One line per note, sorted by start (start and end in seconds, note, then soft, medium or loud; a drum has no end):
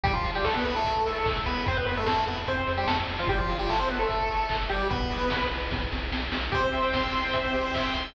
0.04 0.21 C2 loud
0.04 0.13 G3 medium
0.04 0.13 G4 medium
0.04 kick loud
0.04 closed hi-hat loud
0.13 0.31 F3 medium
0.13 0.31 F4 medium
0.24 0.41 C2 medium
0.24 open hi-hat loud
0.35 0.45 G3 medium
0.35 0.45 G4 medium
0.44 0.62 C2 medium
0.44 0.54 A3 medium
0.44 0.54 A4 medium
0.44 kick medium
0.44 clap loud
0.55 0.64 B3 medium
0.55 0.64 B4 medium
0.65 0.82 C2 medium
0.65 0.75 B3 medium
0.65 0.75 B4 medium
0.65 open hi-hat loud
0.76 1.34 A3 medium
0.76 1.34 A4 medium
0.84 1.02 C2 medium
0.84 kick medium
0.84 closed hi-hat loud
1.06 1.23 C2 medium
1.06 open hi-hat loud
1.26 1.43 C2 medium
1.26 kick loud
1.26 clap loud
1.46 1.64 C2 medium
1.46 1.65 B3 medium
1.46 1.65 B4 medium
1.46 open hi-hat medium
1.66 1.84 F2 medium
1.66 1.77 C4 medium
1.66 1.77 C5 medium
1.66 kick loud
1.66 closed hi-hat loud
1.77 1.85 B3 medium
1.77 1.85 B4 medium
1.86 2.04 F2 medium
1.86 1.95 B3 medium
1.86 1.95 B4 medium
1.86 open hi-hat loud
1.97 2.06 A3 medium
1.97 2.06 A4 medium
2.06 2.24 F2 medium
2.06 2.25 A3 medium
2.06 2.25 A4 medium
2.06 kick loud
2.06 snare loud
2.27 2.44 F2 medium
2.27 2.37 B3 medium
2.27 2.37 B4 medium
2.27 open hi-hat medium
2.47 2.65 F2 medium
2.47 2.73 C4 soft
2.47 2.73 C5 medium
2.47 kick medium
2.47 closed hi-hat loud
2.67 2.85 F2 medium
2.67 open hi-hat medium
2.77 2.87 G3 medium
2.77 2.87 G4 medium
2.87 3.05 F2 medium
2.87 2.97 A3 medium
2.87 2.97 A4 medium
2.87 kick loud
2.87 snare loud
3.07 3.26 F2 medium
3.07 open hi-hat medium
3.19 3.29 F3 medium
3.19 3.29 F4 medium
3.27 3.46 G1 medium
3.27 3.39 G3 medium
3.27 3.39 G4 medium
3.27 kick loud
3.27 closed hi-hat loud
3.38 3.58 F3 medium
3.38 3.58 F4 medium
3.49 3.67 G1 medium
3.49 open hi-hat loud
3.59 3.69 G3 medium
3.59 3.69 G4 medium
3.69 3.86 G1 medium
3.69 3.79 A3 medium
3.69 3.79 A4 medium
3.69 kick medium
3.69 clap loud
3.79 3.89 C4 medium
3.79 3.89 C5 medium
3.89 4.06 G1 medium
3.89 4.00 B3 medium
3.89 4.00 B4 medium
3.89 open hi-hat medium
3.99 4.57 A3 medium
3.99 4.57 A4 medium
4.09 4.27 G1 medium
4.09 kick loud
4.09 closed hi-hat loud
4.30 4.47 G1 medium
4.30 open hi-hat medium
4.49 4.67 G1 medium
4.49 kick loud
4.49 clap loud
4.69 4.88 G1 medium
4.69 4.88 G3 medium
4.69 4.88 G4 medium
4.69 open hi-hat medium
4.90 5.08 B1 medium
4.90 5.47 B3 medium
4.90 5.47 B4 medium
4.90 kick loud
4.90 closed hi-hat loud
5.11 5.28 B1 medium
5.11 open hi-hat loud
5.30 5.49 B1 medium
5.30 kick loud
5.30 snare loud
5.51 5.69 B1 medium
5.51 open hi-hat loud
5.71 5.89 B1 medium
5.71 kick loud
5.71 snare medium
5.92 6.10 B1 medium
5.92 snare medium
6.12 6.29 B1 medium
6.12 snare loud
6.32 6.49 B1 medium
6.32 snare loud
6.52 6.70 C2 medium
6.52 7.96 C4 medium
6.52 6.61 G4 loud
6.52 7.96 C5 medium
6.52 kick loud
6.52 closed hi-hat loud
6.64 6.73 C5 medium
6.73 6.91 C2 medium
6.73 6.82 E5 medium
6.73 open hi-hat medium
6.84 6.93 G5 medium
6.93 7.11 C2 medium
6.93 7.03 C6 medium
6.93 kick loud
6.93 snare loud
7.03 7.13 E6 medium
7.13 7.31 C2 medium
7.13 7.24 C6 medium
7.13 open hi-hat loud
7.24 7.34 G5 medium
7.33 7.51 C2 medium
7.33 7.42 E5 medium
7.33 kick loud
7.33 closed hi-hat loud
7.44 7.53 C5 medium
7.53 7.72 C2 medium
7.53 7.62 G4 medium
7.53 open hi-hat medium
7.65 7.74 C5 medium
7.74 7.92 C2 medium
7.74 7.84 E5 medium
7.74 kick loud
7.74 clap loud
7.85 7.95 G5 medium
7.94 8.12 C2 medium
7.94 8.04 C6 medium
7.94 open hi-hat medium
8.04 8.13 E6 medium